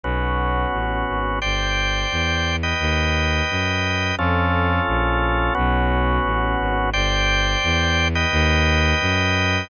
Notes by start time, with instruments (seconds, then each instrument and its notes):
0.04 violin B1, drawbar organ B3 C#4 F#4
0.73 violin A1
1.08 violin G#1
1.42 violin G1, drawbar organ C5 D5 G5
2.11 violin E2
2.63 drawbar organ B4 D#5 G5
2.80 violin D#2
3.50 violin F#2
4.18 violin F2, drawbar organ C#4 F4 A4
4.88 violin A#1
5.55 violin B1, drawbar organ B3 C#4 F#4
6.24 violin A1
6.60 violin G#1
6.93 violin G1, drawbar organ C5 D5 G5
7.63 violin E2
8.15 drawbar organ B4 D#5 G5
8.32 violin D#2
9.01 violin F#2